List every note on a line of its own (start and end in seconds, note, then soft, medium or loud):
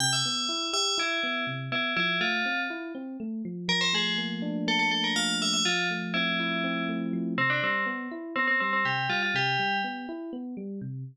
0.00 0.22 C3 loud
0.00 0.12 G5 medium
0.13 0.66 E5 medium
0.25 0.48 B3 medium
0.49 0.71 E4 medium
0.73 0.95 G4 medium
0.73 0.97 E5 medium
0.98 1.20 E4 loud
0.98 1.44 E4 medium
1.23 1.45 B3 medium
1.47 1.69 C3 medium
1.72 1.94 B3 medium
1.72 1.92 E4 medium
1.97 2.19 F3 loud
1.97 2.18 E4 medium
2.20 2.43 A3 medium
2.20 2.60 F4 medium
2.46 2.68 C4 medium
2.70 2.92 E4 medium
2.95 3.17 C4 medium
3.20 3.42 A3 medium
3.45 3.67 F3 medium
3.68 5.15 F3 medium
3.68 3.81 A#4 medium
3.81 3.93 C5 medium
3.93 4.91 A3 medium
3.93 4.17 G#4 medium
4.18 4.67 A#3 medium
4.42 5.59 D4 medium
4.67 5.61 A#3 loud
4.67 4.79 A4 medium
4.79 4.91 A4 medium
4.91 5.41 A3 medium
4.91 5.03 A4 medium
5.04 5.16 A#4 medium
5.16 5.62 F3 medium
5.16 5.36 F5 medium
5.42 5.65 A3 medium
5.42 5.53 E5 medium
5.53 5.65 E5 medium
5.65 7.13 F3 loud
5.65 5.88 F4 medium
5.90 6.88 A3 medium
6.14 6.64 C4 medium
6.14 6.84 E4 medium
6.40 7.33 E4 medium
6.64 7.34 C4 loud
6.89 7.36 A3 medium
7.13 7.37 F3 medium
7.38 7.60 C3 loud
7.38 7.50 C4 medium
7.50 7.61 D4 medium
7.63 7.85 G3 medium
7.63 7.84 C4 medium
7.86 8.08 B3 loud
8.11 8.34 E4 medium
8.36 8.58 B3 medium
8.36 8.47 C4 medium
8.48 8.59 C4 medium
8.60 8.83 G3 medium
8.60 8.72 C4 medium
8.73 8.85 C4 medium
8.85 9.07 C3 medium
8.85 9.06 G4 medium
9.09 9.31 G3 medium
9.09 9.21 F4 medium
9.23 9.34 F4 medium
9.34 9.56 C3 loud
9.34 9.77 G4 medium
9.59 9.81 G3 medium
9.84 10.06 B3 medium
10.09 10.31 E4 medium
10.33 10.55 B3 medium
10.57 10.79 G3 medium
10.81 11.04 C3 medium